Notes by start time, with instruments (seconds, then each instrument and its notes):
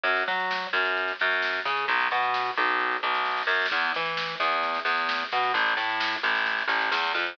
0.04 electric bass (finger) F#2, kick, snare
0.16 snare
0.28 electric bass (finger) F#3, snare
0.39 snare
0.51 snare
0.62 snare
0.73 electric bass (finger) F#2, snare
0.85 snare
0.97 kick, snare
1.08 snare
1.19 electric bass (finger) F#2, snare
1.31 snare
1.42 snare
1.54 snare
1.65 electric bass (finger) C#3, snare
1.77 snare
1.88 electric bass (finger) B1, kick, snare
2.00 snare
2.11 electric bass (finger) B2, snare
2.23 snare
2.34 snare
2.45 snare
2.57 electric bass (finger) B1, snare
2.68 snare
2.80 kick, snare
2.91 snare
3.03 electric bass (finger) B1, snare
3.14 snare
3.26 snare
3.31 snare
3.37 snare
3.43 snare
3.47 electric bass (finger) F#2, snare
3.54 snare
3.60 snare
3.66 snare
3.71 electric bass (finger) E2, kick, snare
3.83 snare
3.94 electric bass (finger) E3, snare
4.06 snare
4.17 snare
4.29 snare
4.40 electric bass (finger) E2, snare
4.52 snare
4.63 kick, snare
4.74 snare
4.85 electric bass (finger) E2, snare
4.97 snare
5.09 snare
5.20 snare
5.32 electric bass (finger) B2, snare
5.43 snare
5.54 electric bass (finger) A1, kick, snare
5.66 snare
5.77 electric bass (finger) A2, snare
5.89 snare
6.00 snare
6.12 snare
6.23 electric bass (finger) A1, snare
6.35 snare
6.46 kick, snare
6.58 snare
6.68 electric bass (finger) A1, snare
6.81 snare
6.92 electric bass (finger) E2, snare
7.03 snare
7.14 electric bass (finger) F2, snare
7.26 snare